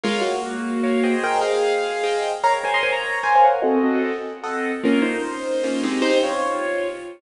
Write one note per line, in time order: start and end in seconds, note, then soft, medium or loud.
0.04 0.23 G#3 medium
0.04 0.23 F4 medium
0.04 0.32 A#4 loud
0.04 0.32 C#5 loud
0.04 0.32 F5 loud
0.21 1.14 A#3 medium
0.21 1.14 F#4 medium
0.84 1.03 A#4 medium
0.84 1.03 C#5 medium
0.84 1.03 F5 medium
1.04 1.52 G#4 loud
1.04 1.52 C5 loud
1.04 1.52 D#5 loud
1.04 1.52 G5 medium
1.24 1.40 A#4 medium
1.24 1.40 G5 medium
1.42 2.23 G#4 medium
1.42 2.23 F5 medium
2.04 2.31 G#4 medium
2.04 2.31 C5 medium
2.04 2.31 D#5 medium
2.04 2.31 G5 medium
2.44 2.58 A#4 loud
2.44 2.53 C#5 medium
2.44 2.58 F5 loud
2.44 2.53 A#5 medium
2.64 2.92 A#4 medium
2.64 2.74 C5 medium
2.64 2.92 C#5 medium
2.64 2.92 F5 medium
2.64 2.74 G#5 medium
2.74 2.83 D#5 medium
2.74 2.83 C6 medium
2.83 2.93 C5 medium
2.83 2.93 G#5 medium
2.92 3.19 C#5 medium
2.92 3.19 A#5 medium
3.23 3.52 A#4 medium
3.23 3.33 C5 medium
3.23 3.52 C#5 medium
3.23 3.52 F5 medium
3.23 3.33 G#5 medium
3.35 3.45 C5 medium
3.35 3.45 G#5 medium
3.44 3.63 A#4 medium
3.44 3.63 F#5 medium
3.62 3.78 C4 loud
3.62 3.98 F#4 medium
3.62 3.78 A4 loud
3.62 3.98 D#5 medium
3.62 3.78 F#5 medium
3.84 4.12 C4 medium
3.84 4.12 A4 medium
3.84 4.12 D#5 medium
3.84 4.12 F#5 medium
4.44 4.72 C4 medium
4.44 4.72 A4 medium
4.44 4.72 D#5 medium
4.44 4.72 F#5 medium
4.83 5.12 A#3 loud
4.83 5.02 C#4 medium
4.83 5.12 F4 loud
4.83 5.02 A#4 medium
5.02 5.89 D#4 medium
5.02 5.89 C5 medium
5.64 5.83 A#3 medium
5.64 5.83 C#4 medium
5.64 5.83 F4 medium
5.83 6.32 G#3 loud
5.83 6.32 C4 loud
5.83 6.32 D#4 medium
5.83 6.32 G4 medium
6.02 6.18 D#4 medium
6.02 6.18 C5 medium
6.23 6.88 F4 medium
6.23 6.88 C#5 medium